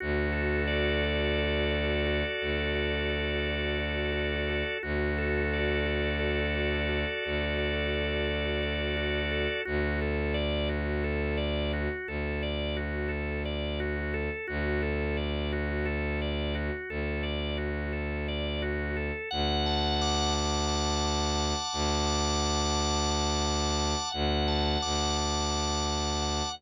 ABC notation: X:1
M:7/8
L:1/8
Q:1/4=87
K:D
V:1 name="Violin" clef=bass
D,,7 | D,,7 | D,,7 | D,,7 |
D,,7 | D,,7 | D,,7 | D,,7 |
D,,7 | D,,7 | D,,2 D,,5 |]
V:2 name="Drawbar Organ"
F A d F A d F | A d F A d F A | F A d F A d F | A d F A d F A |
F A d F A d F | A d F A d F A | F A d F A d F | A d F A d F A |
f a d' f a d' f | a d' f a d' f a | f a d' f a d' f |]